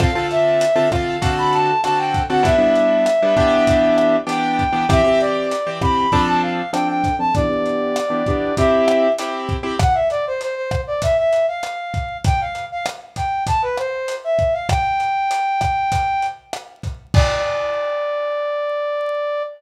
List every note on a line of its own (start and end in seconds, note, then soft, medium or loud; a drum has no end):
0.00 0.10 D3 medium
0.00 0.10 C4 loud
0.00 0.10 F4 medium
0.00 0.10 A4 medium
0.00 0.27 F5 loud
0.00 kick medium
0.00 cross-stick medium
0.00 closed hi-hat medium
0.15 0.64 D3 medium
0.15 0.64 C4 medium
0.15 0.64 F4 medium
0.15 0.64 A4 medium
0.31 0.89 E5 loud
0.31 closed hi-hat medium
0.61 closed hi-hat loud
0.76 0.88 D3 medium
0.76 0.88 C4 medium
0.76 0.88 F4 medium
0.76 0.88 A4 medium
0.92 1.17 D3 medium
0.92 1.17 C4 medium
0.92 1.17 F4 medium
0.92 1.17 A4 medium
0.92 1.31 F5 medium
0.92 kick medium
0.92 cross-stick medium
0.92 closed hi-hat medium
1.22 1.71 D3 medium
1.22 1.71 C4 medium
1.22 1.71 F#4 medium
1.22 1.71 A4 medium
1.22 kick medium
1.22 closed hi-hat medium
1.38 1.53 B5 medium
1.53 1.81 A5 loud
1.53 closed hi-hat medium
1.84 2.22 D3 medium
1.84 2.22 C4 medium
1.84 2.22 F#4 medium
1.84 2.22 A4 medium
1.84 1.98 A5 medium
1.84 cross-stick medium
1.84 closed hi-hat medium
1.98 2.23 G5 medium
2.14 kick medium
2.14 closed hi-hat medium
2.29 2.42 D3 medium
2.29 2.42 C4 medium
2.29 2.42 F#4 medium
2.29 2.42 A4 medium
2.29 2.44 F#5 medium
2.43 2.55 G3 medium
2.43 2.55 B3 medium
2.43 2.55 D4 medium
2.43 2.55 E4 medium
2.43 4.16 E5 loud
2.43 kick medium
2.43 closed hi-hat medium
2.58 3.07 G3 medium
2.58 3.07 B3 medium
2.58 3.07 D4 medium
2.58 3.07 E4 medium
2.75 closed hi-hat medium
3.06 cross-stick medium
3.06 closed hi-hat medium
3.22 3.35 G3 medium
3.22 3.35 B3 medium
3.22 3.35 D4 medium
3.22 3.35 E4 medium
3.37 4.16 E3 medium
3.37 4.16 B3 medium
3.37 4.16 D4 loud
3.37 4.16 G4 loud
3.37 kick medium
3.37 closed hi-hat medium
3.67 kick medium
3.67 closed hi-hat medium
3.98 cross-stick medium
3.98 closed hi-hat medium
4.27 4.63 E3 medium
4.27 4.63 B3 medium
4.27 4.63 D4 medium
4.27 4.63 G4 medium
4.27 4.87 G5 loud
4.27 closed hi-hat medium
4.59 kick medium
4.59 closed hi-hat medium
4.73 4.85 E3 medium
4.73 4.85 B3 medium
4.73 4.85 D4 medium
4.73 4.85 G4 medium
4.89 5.01 E3 loud
4.89 5.01 C4 loud
4.89 5.01 G4 loud
4.89 5.20 E5 loud
4.89 kick medium
4.89 cross-stick medium
4.89 closed hi-hat medium
5.04 5.53 E3 medium
5.04 5.53 C4 medium
5.04 5.53 G4 medium
5.20 5.70 D5 medium
5.20 closed hi-hat medium
5.51 closed hi-hat medium
5.67 5.79 E3 medium
5.67 5.79 C4 medium
5.67 5.79 G4 medium
5.82 6.06 E3 medium
5.82 6.06 C4 medium
5.82 6.06 G4 medium
5.82 6.22 B5 medium
5.82 kick medium
5.82 cross-stick medium
6.12 6.61 F3 loud
6.12 6.61 C4 medium
6.12 6.61 D4 loud
6.12 6.61 A4 loud
6.12 kick medium
6.12 closed hi-hat medium
6.27 6.42 A5 medium
6.42 6.71 F5 medium
6.73 7.10 F3 medium
6.73 7.10 C4 medium
6.73 7.10 D4 medium
6.73 7.10 A4 medium
6.73 6.88 G5 loud
6.73 cross-stick medium
6.73 closed hi-hat medium
6.89 7.16 G5 medium
7.04 kick medium
7.04 closed hi-hat medium
7.19 7.31 F3 medium
7.19 7.31 C4 medium
7.19 7.31 D4 medium
7.19 7.31 A4 medium
7.19 7.34 A5 medium
7.35 7.47 E3 loud
7.35 7.47 B3 medium
7.35 7.47 D4 medium
7.35 7.47 G4 loud
7.35 8.54 D5 loud
7.35 kick medium
7.35 closed hi-hat medium
7.49 7.98 E3 medium
7.49 7.98 B3 medium
7.49 7.98 D4 medium
7.49 7.98 G4 medium
7.66 closed hi-hat medium
7.96 cross-stick medium
7.96 closed hi-hat medium
8.10 8.22 E3 medium
8.10 8.22 B3 medium
8.10 8.22 D4 medium
8.10 8.22 G4 medium
8.26 8.52 E3 medium
8.26 8.52 B3 medium
8.26 8.52 D4 medium
8.26 8.52 G4 medium
8.26 kick medium
8.26 closed hi-hat medium
8.57 9.07 C4 loud
8.57 9.07 E4 medium
8.57 9.07 G4 loud
8.57 9.13 E5 medium
8.57 kick medium
8.57 closed hi-hat medium
8.88 cross-stick medium
8.88 closed hi-hat medium
9.18 9.56 C4 medium
9.18 9.56 E4 medium
9.18 9.56 G4 medium
9.18 closed hi-hat loud
9.49 kick medium
9.49 closed hi-hat medium
9.63 9.75 C4 medium
9.63 9.75 E4 medium
9.63 9.75 G4 medium
9.79 9.95 F#5 loud
9.79 kick medium
9.79 cross-stick loud
9.79 closed hi-hat medium
9.94 10.08 E5 medium
10.10 10.25 D5 loud
10.10 closed hi-hat medium
10.27 10.41 C5 medium
10.41 10.55 C5 medium
10.41 closed hi-hat medium
10.55 10.81 C5 medium
10.71 kick medium
10.71 cross-stick medium
10.71 closed hi-hat medium
10.87 11.02 D5 medium
11.02 11.17 E5 loud
11.02 kick medium
11.02 closed hi-hat loud
11.17 11.46 E5 medium
11.33 closed hi-hat medium
11.48 12.17 F5 medium
11.63 cross-stick medium
11.63 closed hi-hat medium
11.94 kick medium
11.94 closed hi-hat medium
12.24 12.40 G5 loud
12.24 kick medium
12.24 closed hi-hat medium
12.40 12.65 F5 medium
12.55 closed hi-hat medium
12.72 12.86 F5 loud
12.86 cross-stick medium
12.86 closed hi-hat medium
13.16 13.44 G5 medium
13.16 kick medium
13.16 closed hi-hat medium
13.47 13.62 A5 medium
13.47 kick medium
13.47 closed hi-hat medium
13.62 13.77 B4 medium
13.77 14.15 C5 medium
13.77 cross-stick medium
13.77 closed hi-hat medium
14.08 closed hi-hat medium
14.24 14.53 E5 medium
14.39 kick medium
14.39 closed hi-hat medium
14.53 14.68 F5 medium
14.69 16.26 G5 loud
14.69 kick medium
14.69 cross-stick loud
14.69 closed hi-hat medium
15.00 closed hi-hat medium
15.31 closed hi-hat medium
15.61 kick medium
15.61 cross-stick medium
15.61 closed hi-hat medium
15.92 kick medium
15.92 closed hi-hat medium
16.22 closed hi-hat medium
16.53 cross-stick medium
16.53 closed hi-hat medium
16.83 kick medium
16.83 closed hi-hat medium
17.14 19.42 D5 loud
17.14 kick loud
17.14 crash loud